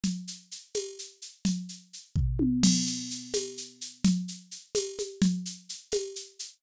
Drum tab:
CC |------|-----|x-----|-----|
TB |---x--|-----|---x--|---x-|
SH |xxxxxx|xxx--|xxxxxx|xxxxx|
T1 |------|----o|------|-----|
FT |------|---o-|------|-----|
CG |O--o--|O----|O--o--|O--oo|
BD |------|---o-|------|-----|

CC |------|
TB |---x--|
SH |xxxxxx|
T1 |------|
FT |------|
CG |O--o--|
BD |------|